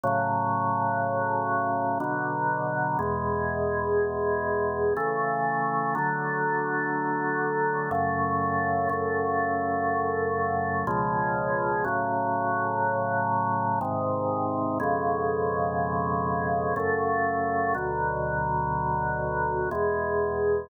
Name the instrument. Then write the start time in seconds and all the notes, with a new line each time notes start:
drawbar organ
0.03 A2 C#3 F#3
2.00 B2 D3 F#3
2.99 E2 B2 G#3
4.97 C#3 E3 A3
5.95 D3 F#3 A3
7.91 F#2 C#3 A3
8.89 F#2 C#3 A3
10.87 C#2 B2 F3 G#3
11.84 A2 C#3 F#3
13.81 G#2 C3 D#3
14.80 F2 B2 C#3 G#3
16.76 F#2 C#3 A3
17.74 D2 B2 F#3
19.71 E2 B2 G#3